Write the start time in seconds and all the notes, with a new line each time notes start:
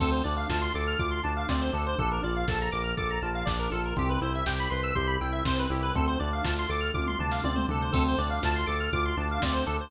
0.00 D2 C4 A4, kick, crash
0.11 C5, closed hi-hat
0.24 D2 D4 D5, open hi-hat
0.37 F5, closed hi-hat
0.49 D2 F4 A5, kick, snare
0.62 C6, closed hi-hat
0.74 D2 A4 D6, open hi-hat
0.87 F6, closed hi-hat
0.99 D2 F4 D6, kick, closed hi-hat
1.11 C6, closed hi-hat
1.23 D2 D4 A5, open hi-hat
1.36 F5, closed hi-hat
1.49 D2 C4 D5, kick, snare
1.61 C5, closed hi-hat
1.73 D2 D4 A4, open hi-hat
1.86 C5, closed hi-hat
1.98 A#1 D4 A4, kick, closed hi-hat
2.11 A#4, closed hi-hat
2.23 A#1 F4 D5, open hi-hat
2.35 F5, closed hi-hat
2.48 A#1 A4 A5, kick, snare
2.60 A#5, closed hi-hat
2.72 A#1 A#4 D6, open hi-hat
2.83 F6, closed hi-hat
2.97 A#1 A4 D6, kick, closed hi-hat
3.10 A#5, closed hi-hat
3.21 A#1 F4 A5, open hi-hat
3.35 F5, closed hi-hat
3.45 A#1 D4 D5, kick, snare
3.59 A#4, closed hi-hat
3.71 A#1 F4 A4, open hi-hat
3.84 A#4, closed hi-hat
3.96 C2 C4 G4, kick, closed hi-hat
4.09 B4, closed hi-hat
4.21 C2 E4 C5, open hi-hat
4.34 E5, closed hi-hat
4.46 C2 G4 G5, kick, snare
4.59 B5, closed hi-hat
4.70 C2 B4 C6, open hi-hat
4.83 E6, closed hi-hat
4.95 C2 G4 C6, kick, closed hi-hat
5.07 B5, closed hi-hat
5.21 C2 E4 G5, open hi-hat
5.32 E5, closed hi-hat
5.45 C2 C4 C5, kick, snare
5.58 B4, closed hi-hat
5.70 C2 E4 G4, open hi-hat
5.82 B4, open hi-hat
5.95 D2 C4 A4, kick, closed hi-hat
6.07 C5, closed hi-hat
6.19 D2 D4 D5, open hi-hat
6.32 F5, closed hi-hat
6.44 D2 F4 A5, kick, snare
6.57 C6, closed hi-hat
6.69 D2 A4 D6, open hi-hat
6.80 F6, closed hi-hat
6.94 D2 F4 D6, kick, high tom
7.07 C6, mid tom
7.19 D2 D4 A5, floor tom
7.31 F5, snare
7.44 D2 C4 D5, high tom
7.55 C5, mid tom
7.69 D2 D4 A4, floor tom
7.82 C5
7.92 D2 C4 A4, kick, crash
8.06 C5, closed hi-hat
8.18 D2 D4 D5, open hi-hat
8.30 F5, closed hi-hat
8.43 D2 F4 A5, kick, snare
8.55 C6, closed hi-hat
8.66 D2 A4 D6, open hi-hat
8.80 F6, closed hi-hat
8.93 D2 F4 D6, kick, closed hi-hat
9.05 C6, closed hi-hat
9.17 D2 D4 A5, open hi-hat
9.29 F5, closed hi-hat
9.42 D2 C4 D5, kick, snare
9.53 C5, closed hi-hat
9.66 D2 D4 A4, open hi-hat
9.79 C5, closed hi-hat